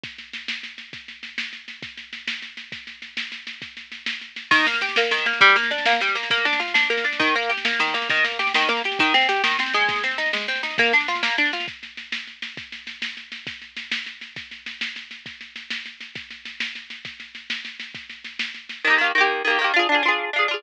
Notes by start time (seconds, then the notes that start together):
0.04 kick, snare
0.18 snare
0.33 snare
0.48 snare
0.63 snare
0.78 snare
0.93 kick, snare
1.08 snare
1.23 snare
1.38 snare
1.53 snare
1.68 snare
1.83 kick, snare
1.97 snare
2.13 snare
2.28 snare
2.42 snare
2.57 snare
2.72 kick, snare
2.87 snare
3.02 snare
3.17 snare
3.32 snare
3.47 snare
3.62 kick, snare
3.77 snare
3.92 snare
4.06 snare
4.21 snare
4.36 snare
4.51 D#3, kick, snare, crash
4.59 snare
4.66 A#3, snare
4.74 snare
4.81 G4, snare
4.89 snare
4.96 A#3, snare
5.03 snare
5.11 D#3, snare
5.18 snare
5.26 A#3, snare
5.33 snare
5.41 G3, kick, snare
5.49 snare
5.56 A#3, snare
5.63 snare
5.71 D4, snare
5.78 snare
5.86 A#3, snare
5.93 snare
6.01 G3, snare
6.08 snare
6.15 A#3, snare
6.23 snare
6.30 A#3, kick, snare
6.38 snare
6.45 D4, snare
6.53 snare
6.60 F4, snare
6.68 snare
6.74 D4, snare
6.83 snare
6.90 A#3, snare
6.97 snare
7.04 D4, snare
7.13 snare
7.20 D#3, kick, snare
7.27 snare
7.35 A#3, snare
7.43 snare
7.49 G4, snare
7.57 snare
7.65 A#3, snare
7.72 snare
7.79 D#3, snare
7.87 snare
7.94 A#3, snare
8.02 snare
8.10 D#3, kick, snare
8.17 snare
8.24 A#3, snare
8.32 snare
8.39 G4, snare
8.47 snare
8.54 D#3, snare
8.62 snare
8.69 A#3, snare
8.77 snare
8.84 G4, snare
8.92 snare
8.99 D#3, kick, snare
9.06 snare
9.14 C4, snare
9.21 snare
9.29 G4, snare
9.36 snare
9.44 D#3, snare
9.51 snare
9.59 C4, snare
9.66 snare
9.74 G#3, snare
9.81 snare
9.89 kick, snare
9.96 snare
10.03 C4, snare
10.11 snare
10.18 D#4, snare
10.26 snare
10.33 G#3, snare
10.41 snare
10.48 C4, snare
10.56 snare
10.63 D#4, snare
10.71 snare
10.78 A#3, kick, snare
10.86 snare
10.93 D4, snare
11.00 snare
11.08 F4, snare
11.15 snare
11.23 A#3, snare
11.30 snare
11.38 D4, snare
11.45 snare
11.53 F4, snare
11.60 snare
11.68 kick, snare
11.83 snare
11.97 snare
12.12 snare
12.27 snare
12.42 snare
12.57 kick, snare
12.72 snare
12.87 snare
13.02 snare
13.17 snare
13.32 snare
13.47 kick, snare
13.62 snare
13.77 snare
13.92 snare
14.06 snare
14.21 snare
14.36 kick, snare
14.51 snare
14.66 snare
14.81 snare
14.96 snare
15.11 snare
15.26 kick, snare
15.41 snare
15.56 snare
15.70 snare
15.86 snare
16.01 snare
16.15 kick, snare
16.31 snare
16.45 snare
16.60 snare
16.75 snare
16.90 snare
17.05 kick, snare
17.20 snare
17.35 snare
17.50 snare
17.65 snare
17.80 snare
17.95 kick, snare
18.10 snare
18.24 snare
18.39 snare
18.54 snare
18.69 snare
18.85 D#3 A#3
18.90 G4
18.98 D#3 A#3
19.04 G4
19.15 D#3 A#3
19.21 G4
19.45 D#3 A#3
19.50 G4
19.59 D#3 A#3
19.64 G4
19.74 D4 F4
19.79 G#4
19.89 D4 F4
19.95 G#4
20.03 D4 F4
20.08 G#4
20.33 D4 F4
20.39 G#4
20.48 D4 F4
20.54 G#4